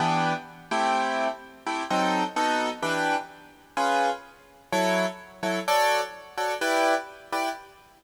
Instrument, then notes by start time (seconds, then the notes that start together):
acoustic grand piano
0.00 E3 B3 D4 G4
0.71 A3 C4 E4 G4
1.67 A3 C4 E4 G4
1.90 F#3 C4 D#4 A4
2.36 B3 D#4 F#4 A4
2.82 E3 D4 G4 B4
3.77 C#4 F4 G#4 B4
4.72 F#3 E4 A4 C#5
5.43 F#3 E4 A4 C#5
5.68 F#4 A4 C#5 D5
6.38 F#4 A4 C#5 D5
6.61 E4 G4 B4 D5
7.32 E4 G4 B4 D5